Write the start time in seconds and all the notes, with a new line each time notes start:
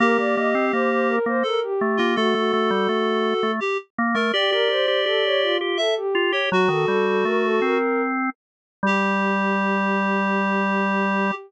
0.00 A#3 G4 A#4
0.18 A#3 D5
0.36 A#3 D#5
0.55 C4
0.73 A#3 C5
0.90 C5
1.08 A#4
1.26 A#3 C5
1.43 A4 A#4
1.63 G4
1.81 A3
1.97 A#3 F4
2.16 A3 F#4 A4
2.34 A3 F#4
2.53 A3
2.70 G3
2.89 A3
3.43 A3
3.60 G4
3.98 A#3
4.14 A3 A#4
4.33 G4 D5
4.52 G4 A#4
4.69 G4 C5
4.88 G4
5.06 G4 A4
5.24 C#5
5.42 F4
5.60 F4 G4
5.77 A4 E5
5.96 G4
6.15 F4
6.32 G4 C#5
6.50 F#3 F#4
6.68 D#3 A4
6.87 G3 A4
7.06 A4
7.25 A3 A#4
7.44 A4
7.62 C4 A#4
8.83 G3 G4